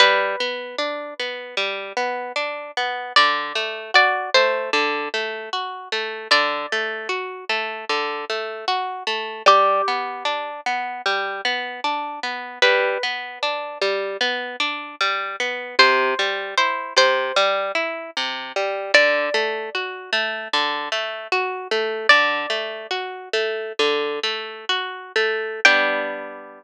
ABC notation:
X:1
M:4/4
L:1/8
Q:1/4=76
K:G
V:1 name="Acoustic Guitar (steel)"
B8 | d2 d c z4 | d8 | G3 z5 |
B8 | c2 c c z4 | d8 | "^rit." d5 z3 |
g8 |]
V:2 name="Acoustic Guitar (steel)"
G, B, D B, G, B, D B, | D, A, F A, D, A, F A, | D, A, F A, D, A, F A, | G, B, D B, G, B, D B, |
G, B, D G, B, D G, B, | C, G, E C, G, E C, G, | D, A, F A, D, A, F A, | "^rit." D, A, F A, D, A, F A, |
[G,B,D]8 |]